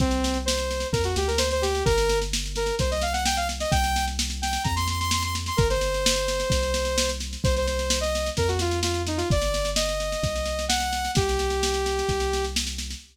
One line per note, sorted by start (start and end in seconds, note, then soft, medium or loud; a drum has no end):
0.00 0.85 C2 loud
0.00 0.38 C4 medium
0.00 kick loud
0.00 snare medium
0.11 snare medium
0.24 snare loud
0.34 snare medium
0.45 0.87 C5 medium
0.45 snare loud
0.57 snare medium
0.71 snare medium
0.80 snare medium
0.92 1.15 F2 loud
0.92 1.03 A#4 medium
0.92 kick loud
0.92 snare medium
1.04 1.15 F#4 medium
1.04 snare medium
1.16 1.83 D2 loud
1.16 1.28 G4 medium
1.16 snare medium
1.28 1.39 A#4 medium
1.28 snare medium
1.38 1.49 C5 medium
1.38 snare loud
1.51 1.63 C5 medium
1.51 snare medium
1.62 1.84 G4 medium
1.62 snare medium
1.75 snare medium
1.85 2.72 G1 loud
1.85 2.19 A#4 medium
1.85 kick loud
1.85 snare medium
1.98 snare medium
2.09 snare medium
2.22 snare medium
2.33 snare loud
2.46 snare medium
2.56 2.75 A#4 medium
2.56 snare medium
2.66 snare medium
2.79 3.65 C2 medium
2.79 2.91 C5 medium
2.79 kick loud
2.79 snare medium
2.91 3.02 D#5 medium
2.91 snare medium
3.01 3.13 F5 medium
3.01 snare medium
3.13 3.24 F#5 medium
3.13 snare medium
3.25 3.36 G5 medium
3.25 snare loud
3.37 3.48 F5 medium
3.37 snare medium
3.49 snare medium
3.60 3.71 D#5 medium
3.60 snare medium
3.71 4.58 C2 loud
3.71 4.05 G5 medium
3.71 kick loud
3.71 snare medium
3.84 snare medium
3.96 snare medium
4.07 snare medium
4.19 snare loud
4.30 snare medium
4.42 4.63 G5 medium
4.42 snare medium
4.53 snare medium
4.64 5.51 F2 loud
4.64 4.75 A#5 medium
4.64 kick loud
4.64 snare medium
4.76 4.87 C6 medium
4.76 snare medium
4.87 4.99 C6 medium
4.87 snare medium
5.00 5.11 C6 medium
5.00 snare medium
5.11 5.23 C6 medium
5.11 snare loud
5.22 5.34 C6 medium
5.22 snare medium
5.35 snare medium
5.46 5.58 C6 medium
5.46 snare medium
5.57 6.44 G1 medium
5.57 5.68 A#4 medium
5.57 kick loud
5.57 snare medium
5.70 7.10 C5 medium
5.70 snare medium
5.81 snare medium
5.94 snare medium
6.06 snare loud
6.16 snare medium
6.28 snare medium
6.40 snare medium
6.50 7.37 C2 medium
6.50 kick loud
6.50 snare loud
6.63 snare medium
6.74 snare loud
6.85 snare medium
6.98 snare loud
7.09 snare medium
7.20 snare medium
7.33 snare medium
7.44 8.30 C2 loud
7.44 7.55 C5 medium
7.44 kick loud
7.44 snare medium
7.56 7.67 C5 medium
7.56 snare medium
7.67 7.99 C5 medium
7.67 snare medium
7.79 snare medium
7.90 snare loud
8.01 8.29 D#5 medium
8.01 snare medium
8.15 snare medium
8.26 snare medium
8.37 9.23 F2 loud
8.37 8.48 A#4 medium
8.37 kick medium
8.37 snare medium
8.48 8.59 F#4 medium
8.48 snare medium
8.59 8.79 F4 medium
8.59 snare medium
8.71 snare medium
8.83 9.02 F4 medium
8.83 snare loud
8.94 snare medium
9.07 9.18 D#4 medium
9.07 snare medium
9.17 9.28 F4 medium
9.17 snare medium
9.30 10.16 G1 medium
9.30 9.70 D5 medium
9.30 kick loud
9.30 snare medium
9.42 snare medium
9.54 snare medium
9.65 snare medium
9.76 10.65 D#5 medium
9.76 snare loud
9.89 snare medium
10.00 snare medium
10.12 snare medium
10.23 11.09 C2 medium
10.23 kick loud
10.23 snare medium
10.36 snare medium
10.46 snare medium
10.59 snare medium
10.69 11.11 F#5 medium
10.69 snare loud
10.80 snare medium
10.93 snare medium
11.05 snare medium
11.15 12.02 C2 medium
11.15 12.45 G4 medium
11.15 kick loud
11.15 snare loud
11.29 snare medium
11.39 snare medium
11.50 snare medium
11.63 snare loud
11.74 snare medium
11.86 snare medium
11.99 snare medium
12.09 12.95 C2 medium
12.09 kick medium
12.09 snare medium
12.20 snare medium
12.33 snare medium
12.44 snare medium
12.56 snare loud
12.67 snare medium
12.78 snare medium
12.90 snare medium